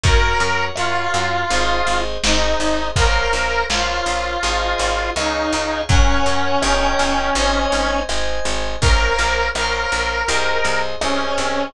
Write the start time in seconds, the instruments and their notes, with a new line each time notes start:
0.03 electric bass (finger) F#2, electric piano 2 F#4 A#4 C#5, lead 1 (square) A#4, kick, closed hi-hat
0.40 electric bass (finger) F#2, closed hi-hat
0.75 electric bass (finger) F#2, lead 1 (square) F4, electric piano 2 F#4 A#4 C#5, cross-stick
1.14 electric bass (finger) F#2, closed hi-hat
1.50 electric bass (finger) G#1, electric piano 2 G#4 C5 D#5, closed hi-hat
1.87 electric bass (finger) G#1, closed hi-hat
2.23 electric bass (finger) G#1, lead 1 (square) D#4, electric piano 2 G#4 C5 D#5, snare
2.60 electric bass (finger) G#1, closed hi-hat
2.96 electric bass (finger) A#1, electric piano 2 A#4 C5 C#5 F5, lead 1 (square) A#4, kick, closed hi-hat
3.33 electric bass (finger) A#1, closed hi-hat
3.69 electric bass (finger) A#1, lead 1 (square) F4, electric piano 2 A#4 C5 C#5 F5, snare
4.06 electric bass (finger) A#1, closed hi-hat
4.42 electric bass (finger) G#1, electric piano 2 G#4 C5 D#5, closed hi-hat
4.78 electric bass (finger) G#1, closed hi-hat
5.16 electric bass (finger) C#2, lead 1 (square) D#4, electric piano 2 G#4 C#5 F5, cross-stick
5.53 electric bass (finger) C#2, closed hi-hat
5.89 electric bass (finger) F#2, lead 1 (square) C#4, electric piano 2 A#4 C#5 F#5, kick, closed hi-hat
6.26 electric bass (finger) F#2, closed hi-hat
6.62 electric bass (finger) G1, electric piano 2 A#4 C#5 D#5 G5, cross-stick
6.99 electric bass (finger) G1, closed hi-hat
7.35 electric bass (finger) G#1, electric piano 2 C5 D#5 G#5, closed hi-hat
7.72 electric bass (finger) G#1, closed hi-hat
8.08 electric bass (finger) G#1, electric piano 2 C5 D#5 G#5, cross-stick
8.45 electric bass (finger) G#1, closed hi-hat
8.81 electric bass (finger) A#1, electric piano 2 A#4 C5 C#5 F5, lead 1 (square) A#4, kick, closed hi-hat
9.18 electric bass (finger) A#1, closed hi-hat
9.54 electric bass (finger) A#1, electric piano 2 A#4 C5 C#5 F5, lead 1 (square) A#4, cross-stick
9.92 electric bass (finger) A#1, closed hi-hat
10.28 electric bass (finger) C2, electric piano 2 G#4 C5 D#5, closed hi-hat
10.64 electric bass (finger) C2, closed hi-hat
11.00 electric bass (finger) C2, lead 1 (square) C#4, electric piano 2 G#4 C5 D#5, cross-stick
11.38 electric bass (finger) C2, closed hi-hat